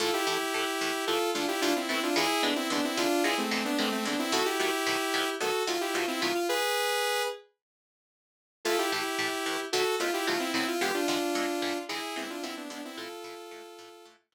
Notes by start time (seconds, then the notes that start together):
0.00 A2 E3 A3 F4 A4
0.13 E4 G4
0.26 A2 E3 A3 E4 G4
0.54 A2 E3 A3
0.81 A2 E3 A3
1.07 A2 E3 A3 F4 A4
1.34 A2 E3 A3 D4 F4
1.48 E4 G4
1.61 A2 E3 A3 D4 F4
1.76 C4 E4
1.89 A2 E3 A3 C4 E4
2.03 D4 F4
2.16 E2 D3 G#3 B3 E4 G#4
2.42 E2 D3 G#3 B3 D4
2.56 C4 E4
2.70 E2 D3 G#3 B3 D4
2.84 C4 E4
2.97 E2 D3 G#3 B3 D4 F4
3.24 E2 D3 G#3 B3 E4 G#4
3.38 A3 C4
3.51 E2 D3 G#3 B3
3.65 B3 D4
3.78 E2 D3 G#3 A3 B3 C4
3.92 A3 C4
4.05 E2 D3 G#3 B3 D4
4.19 C4 E4
4.32 B2 D#3 F#3 A3 F#4 A4
4.45 E4 G4
4.59 B2 D#3 F#3 A3 E4 G4
4.86 B2 D#3 F#3 A3
5.14 B2 D#3 F#3 A3
5.40 B2 D#3 F#3 A3 F#4 A4
5.67 B2 D#3 F#3 A3 F4
5.81 E4 G4
5.93 B2 D#3 F#3 A3 F4
6.08 C4 E4
6.21 B2 D#3 F#3 A3 F4
6.35 F4
6.49 G#4 B4
8.65 A2 E3 A3 F4 A4
8.78 E4 G4
8.92 A2 E3 A3 E4 G4
9.19 A2 E3 A3
9.46 A2 E3 A3
9.73 B2 D#3 F#3 A3 F#4 A4
10.00 B2 D#3 F#3 A3 F4
10.14 E4 G4
10.27 B2 D#3 F#3 A3 F4
10.39 C4 E4
10.54 B2 D#3 F#3 A3 C4 E4
10.68 F4
10.81 E2 D3 G#3 B3 G4
10.94 D4 F4
11.08 E2 D3 G#3 B3 D4 F4
11.35 E2 D3 G#3 B3
11.62 E2 D3 G#3 B3
11.89 E2 D3 G#3 B3 E4 G#4
12.16 E2 D3 G#3 B3 C4 E4
12.30 D4 F4
12.43 E2 D3 G#3 B3 C4 E4
12.57 B3 D4
12.70 E2 D3 G#3 B3 D4
12.85 C4 E4
12.97 A2 E3 A3 F4 A4
13.24 A2 E3 A3
13.51 A2 E3 A3
13.79 A2 E3 A3
14.06 A2 E3 A3
14.32 A2 E3 A3